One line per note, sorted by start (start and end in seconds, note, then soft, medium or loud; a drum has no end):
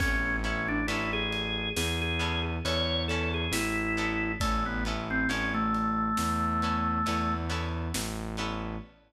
0.00 0.81 A1 loud
0.00 0.41 B3 medium
0.00 0.37 C#4 loud
0.00 0.41 C#4 medium
0.00 0.41 E4 medium
0.00 0.41 A4 medium
0.00 kick loud
0.00 crash medium
0.44 0.85 B3 medium
0.44 0.68 C#4 medium
0.44 0.85 C#4 medium
0.44 0.85 E4 medium
0.44 0.85 A4 medium
0.44 ride medium
0.68 0.87 D4 loud
0.88 1.68 A1 medium
0.88 2.11 B3 medium
0.88 2.11 C#4 medium
0.88 1.11 E4 medium
0.88 2.11 E4 medium
0.88 2.11 A4 medium
0.88 ride medium
1.13 1.69 G#4 loud
1.32 ride medium
1.76 2.57 E2 medium
1.76 2.00 G#4 medium
1.76 snare loud
2.02 2.42 G#4 loud
2.19 2.60 B3 medium
2.19 2.60 C#4 medium
2.19 2.60 E4 medium
2.19 2.60 A4 medium
2.19 ride medium
2.65 3.45 E2 medium
2.65 3.06 B3 medium
2.65 3.06 C#4 medium
2.65 3.06 E4 medium
2.65 3.06 A4 medium
2.65 3.03 C#5 medium
2.65 ride medium
3.08 3.92 B3 medium
3.08 3.92 C#4 medium
3.08 3.92 E4 medium
3.08 3.32 A4 medium
3.08 3.92 A4 medium
3.08 ride medium
3.34 3.52 G#4 medium
3.52 4.32 A1 loud
3.52 4.32 E4 loud
3.52 snare loud
3.97 4.38 B3 medium
3.97 4.38 C#4 medium
3.97 4.38 E4 medium
3.97 4.38 A4 medium
3.97 ride medium
4.40 5.23 A1 loud
4.40 4.64 A3 loud
4.40 4.82 B3 medium
4.40 4.82 C#4 medium
4.40 4.82 E4 medium
4.40 4.82 A4 medium
4.40 kick medium
4.40 ride loud
4.66 4.84 B3 medium
4.85 5.27 B3 medium
4.85 5.27 C#4 medium
4.85 5.27 E4 medium
4.85 5.27 A4 medium
4.85 ride medium
5.10 5.29 C4 medium
5.29 6.10 A1 medium
5.29 6.52 B3 medium
5.29 5.53 C#4 medium
5.29 6.52 C#4 medium
5.29 6.52 E4 medium
5.29 6.52 A4 medium
5.29 ride medium
5.54 7.35 A3 loud
5.74 ride medium
6.17 6.99 E2 loud
6.17 snare loud
6.62 7.04 B3 medium
6.62 7.04 C#4 medium
6.62 7.04 E4 medium
6.62 7.04 A4 medium
6.62 ride medium
7.06 7.88 E2 medium
7.06 7.47 B3 medium
7.06 7.47 C#4 medium
7.06 7.47 E4 medium
7.06 7.47 A4 medium
7.06 ride medium
7.49 8.31 B3 medium
7.49 8.31 C#4 medium
7.49 8.31 E4 medium
7.49 8.31 A4 medium
7.49 ride medium
7.94 8.75 A1 loud
7.94 snare loud
8.37 8.79 B3 medium
8.37 8.79 C#4 medium
8.37 8.79 E4 medium
8.37 8.79 A4 medium
8.37 ride medium